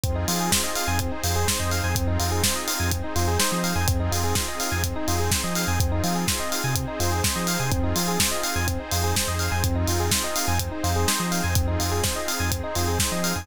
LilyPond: <<
  \new Staff \with { instrumentName = "Electric Piano 1" } { \time 4/4 \key f \minor \tempo 4 = 125 c'16 ees'16 f'16 aes'16 c''16 ees''16 f''16 aes''16 c'16 ees'16 f'16 aes'16 c''16 ees''16 f''16 aes''16 | c'16 ees'16 f'16 aes'16 c''16 ees''16 f''16 aes''16 c'16 ees'16 f'16 aes'16 c''16 ees''16 f''16 aes''16 | c'16 ees'16 f'16 aes'16 c''16 ees''16 f''16 aes''16 c'16 ees'16 f'16 aes'16 c''16 ees''16 f''16 aes''16 | c'16 ees'16 f'16 aes'16 c''16 ees''16 f''16 aes''16 c'16 ees'16 f'16 aes'16 c''16 ees''16 f''16 aes''16 |
c'16 ees'16 f'16 aes'16 c''16 ees''16 f''16 aes''16 c'16 ees'16 f'16 aes'16 c''16 ees''16 f''16 aes''16 | c'16 ees'16 f'16 aes'16 c''16 ees''16 f''16 aes''16 c'16 ees'16 f'16 aes'16 c''16 ees''16 f''16 aes''16 | c'16 ees'16 f'16 aes'16 c''16 ees''16 f''16 aes''16 c'16 ees'16 f'16 aes'16 c''16 ees''16 f''16 aes''16 | }
  \new Staff \with { instrumentName = "Synth Bass 2" } { \clef bass \time 4/4 \key f \minor f,8 f4~ f16 f,8. f,8. f,8 f,16 | f,8 f,4~ f,16 f,8. f,8. f8 f,16 | f,8 f,4~ f,16 f,8. f,8. f8 f,16 | f,8 f4~ f16 c8. f,8. f8 c16 |
f,8 f4~ f16 f,8. f,8. f,8 f,16 | f,8 f,4~ f,16 f,8. f,8. f8 f,16 | f,8 f,4~ f,16 f,8. f,8. f8 f,16 | }
  \new Staff \with { instrumentName = "Pad 5 (bowed)" } { \time 4/4 \key f \minor <c' ees' f' aes'>2 <c' ees' aes' c''>2 | <c' ees' f' aes'>2 <c' ees' aes' c''>2 | <c' ees' f' aes'>2 <c' ees' aes' c''>2 | <c' ees' f' aes'>2 <c' ees' aes' c''>2 |
<c' ees' f' aes'>2 <c' ees' aes' c''>2 | <c' ees' f' aes'>2 <c' ees' aes' c''>2 | <c' ees' f' aes'>2 <c' ees' aes' c''>2 | }
  \new DrumStaff \with { instrumentName = "Drums" } \drummode { \time 4/4 <hh bd>8 hho8 <bd sn>8 hho8 <hh bd>8 hho8 <bd sn>8 hho8 | <hh bd>8 hho8 <bd sn>8 hho8 <hh bd>8 hho8 sn8 hho8 | <hh bd>8 hho8 <bd sn>8 hho8 <hh bd>8 hho8 <bd sn>8 hho8 | <hh bd>8 hho8 <bd sn>8 hho8 <hh bd>8 hho8 <bd sn>8 hho8 |
<hh bd>8 hho8 <bd sn>8 hho8 <hh bd>8 hho8 <bd sn>8 hho8 | <hh bd>8 hho8 <bd sn>8 hho8 <hh bd>8 hho8 sn8 hho8 | <hh bd>8 hho8 <bd sn>8 hho8 <hh bd>8 hho8 <bd sn>8 hho8 | }
>>